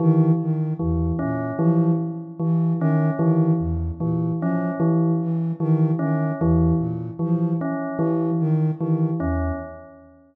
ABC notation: X:1
M:6/4
L:1/8
Q:1/4=75
K:none
V:1 name="Flute" clef=bass
^D, D, E,, ^A,, F, z E, D, D, E,, A,, F, | z E, ^D, D, E,, ^A,, F, z E, D, D, E,, |]
V:2 name="Tubular Bells"
E, z E, ^C E, z E, C E, z E, C | E, z E, ^C E, z E, C E, z E, C |]